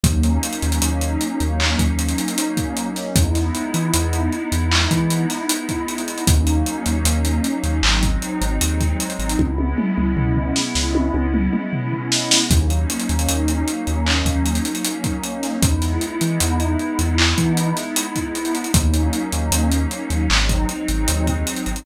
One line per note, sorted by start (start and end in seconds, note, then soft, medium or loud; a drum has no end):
0.03 0.38 D#2 loud
0.03 3.10 F#3 medium
0.03 3.10 A#3 medium
0.03 3.10 C#4 medium
0.03 3.10 D#4 medium
0.03 kick loud
0.03 closed hi-hat loud
0.23 closed hi-hat medium
0.43 closed hi-hat medium
0.53 closed hi-hat medium
0.62 0.80 D#2 medium
0.62 closed hi-hat medium
0.72 closed hi-hat medium
0.82 1.17 D#2 medium
0.82 closed hi-hat loud
1.01 closed hi-hat medium
1.21 closed hi-hat medium
1.40 1.75 D#2 medium
1.40 closed hi-hat medium
1.60 clap loud
1.79 2.14 D#2 medium
1.79 kick medium
1.79 closed hi-hat medium
1.99 closed hi-hat medium
2.08 closed hi-hat medium
2.18 closed hi-hat medium
2.28 closed hi-hat medium
2.38 closed hi-hat loud
2.57 kick medium
2.57 closed hi-hat medium
2.77 closed hi-hat medium
2.96 snare soft
2.96 closed hi-hat medium
3.16 3.51 E2 medium
3.16 6.21 G#3 medium
3.16 6.21 B3 medium
3.16 6.21 D#4 medium
3.16 6.21 E4 medium
3.16 kick loud
3.16 closed hi-hat loud
3.35 snare soft
3.35 closed hi-hat medium
3.55 closed hi-hat medium
3.74 3.91 E3 medium
3.74 closed hi-hat medium
3.94 4.29 E2 medium
3.94 closed hi-hat loud
4.13 closed hi-hat medium
4.32 closed hi-hat medium
4.52 4.87 E2 medium
4.52 closed hi-hat medium
4.71 clap loud
4.91 5.26 E3 medium
4.91 kick medium
4.91 closed hi-hat medium
5.10 closed hi-hat medium
5.30 snare soft
5.30 closed hi-hat medium
5.49 closed hi-hat loud
5.69 kick medium
5.69 closed hi-hat medium
5.88 closed hi-hat medium
5.98 closed hi-hat medium
6.08 closed hi-hat medium
6.18 closed hi-hat medium
6.27 6.63 D#2 medium
6.27 7.80 F#3 medium
6.27 7.80 A#3 medium
6.27 7.80 C#4 medium
6.27 7.80 D#4 medium
6.27 kick loud
6.27 closed hi-hat loud
6.47 closed hi-hat medium
6.66 closed hi-hat medium
6.86 7.03 D#2 medium
6.86 closed hi-hat medium
7.05 7.40 D#2 medium
7.05 closed hi-hat loud
7.25 closed hi-hat medium
7.44 closed hi-hat medium
7.63 7.81 D#2 medium
7.63 closed hi-hat medium
7.83 8.18 G#1 loud
7.83 9.37 F#3 medium
7.83 9.37 G#3 medium
7.83 9.37 C4 medium
7.83 9.37 D#4 medium
7.83 clap loud
8.03 kick medium
8.03 closed hi-hat medium
8.22 closed hi-hat medium
8.41 8.59 G#1 medium
8.41 closed hi-hat medium
8.61 8.96 D#2 medium
8.61 closed hi-hat loud
8.80 kick medium
8.80 closed hi-hat medium
9.00 closed hi-hat medium
9.10 closed hi-hat medium
9.19 9.36 G#1 medium
9.19 closed hi-hat medium
9.29 closed hi-hat medium
9.38 9.74 C#2 medium
9.38 12.44 G#3 medium
9.38 12.44 B3 medium
9.38 12.44 C#4 medium
9.38 12.44 E4 medium
9.38 kick medium
9.38 high tom medium
9.58 high tom medium
9.78 mid tom loud
9.97 10.15 C#2 medium
9.97 mid tom medium
10.17 10.52 C#2 medium
10.17 floor tom loud
10.36 floor tom medium
10.56 snare medium
10.75 11.10 C#2 medium
10.75 snare medium
10.95 high tom medium
11.14 11.49 C#2 medium
11.14 high tom medium
11.34 mid tom loud
11.53 mid tom medium
11.73 floor tom medium
11.92 floor tom medium
12.12 snare loud
12.31 snare loud
12.50 12.85 D#2 loud
12.50 15.56 F#3 medium
12.50 15.56 A#3 medium
12.50 15.56 C#4 medium
12.50 15.56 D#4 medium
12.50 kick loud
12.50 closed hi-hat loud
12.70 closed hi-hat medium
12.90 closed hi-hat medium
13.00 closed hi-hat medium
13.09 13.27 D#2 medium
13.09 closed hi-hat medium
13.19 closed hi-hat medium
13.28 13.63 D#2 medium
13.28 closed hi-hat loud
13.48 closed hi-hat medium
13.68 closed hi-hat medium
13.87 14.22 D#2 medium
13.87 closed hi-hat medium
14.06 clap loud
14.25 14.60 D#2 medium
14.25 kick medium
14.25 closed hi-hat medium
14.45 closed hi-hat medium
14.55 closed hi-hat medium
14.65 closed hi-hat medium
14.75 closed hi-hat medium
14.84 closed hi-hat loud
15.04 kick medium
15.04 closed hi-hat medium
15.23 closed hi-hat medium
15.43 snare soft
15.43 closed hi-hat medium
15.62 15.97 E2 medium
15.62 18.68 G#3 medium
15.62 18.68 B3 medium
15.62 18.68 D#4 medium
15.62 18.68 E4 medium
15.62 kick loud
15.62 closed hi-hat loud
15.82 snare soft
15.82 closed hi-hat medium
16.01 closed hi-hat medium
16.21 16.39 E3 medium
16.21 closed hi-hat medium
16.40 16.76 E2 medium
16.40 closed hi-hat loud
16.60 closed hi-hat medium
16.79 closed hi-hat medium
16.99 17.34 E2 medium
16.99 closed hi-hat medium
17.18 clap loud
17.38 17.73 E3 medium
17.38 kick medium
17.38 closed hi-hat medium
17.57 closed hi-hat medium
17.77 snare soft
17.77 closed hi-hat medium
17.96 closed hi-hat loud
18.16 kick medium
18.16 closed hi-hat medium
18.35 closed hi-hat medium
18.45 closed hi-hat medium
18.55 closed hi-hat medium
18.64 closed hi-hat medium
18.74 19.10 D#2 medium
18.74 20.26 F#3 medium
18.74 20.26 A#3 medium
18.74 20.26 C#4 medium
18.74 20.26 D#4 medium
18.74 kick loud
18.74 closed hi-hat loud
18.94 closed hi-hat medium
19.13 closed hi-hat medium
19.32 19.50 D#2 medium
19.32 closed hi-hat medium
19.51 19.86 D#2 medium
19.51 closed hi-hat loud
19.71 closed hi-hat medium
19.91 closed hi-hat medium
20.10 20.28 D#2 medium
20.10 closed hi-hat medium
20.29 20.65 G#1 loud
20.29 21.82 F#3 medium
20.29 21.82 G#3 medium
20.29 21.82 C4 medium
20.29 21.82 D#4 medium
20.29 clap loud
20.49 kick medium
20.49 closed hi-hat medium
20.69 closed hi-hat medium
20.88 21.06 G#1 medium
20.88 closed hi-hat medium
21.08 21.43 D#2 medium
21.08 closed hi-hat loud
21.27 kick medium
21.27 closed hi-hat medium
21.47 closed hi-hat medium
21.56 closed hi-hat medium
21.66 21.84 G#1 medium
21.66 closed hi-hat medium
21.76 closed hi-hat medium